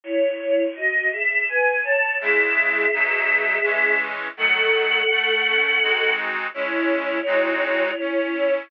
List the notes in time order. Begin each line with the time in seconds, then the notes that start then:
0.04 E4 C#5
0.76 F#4 D#5
1.12 G#4 E5
1.48 B4 G#5
1.84 C#5 A5
2.21 C#3 G#3 E4 G#4 E5
2.93 B2 F#3 D#4
3.63 E3 G#3 C#4
4.37 D#3 F#3 A3 A4 F#5
5.10 A3
5.47 C#4
5.82 G#3 C4 D#4 F#4
6.54 G#3 C#4 E4 C#5
7.26 G#3 C4 D#4 F#4
8.00 C#4
8.34 E4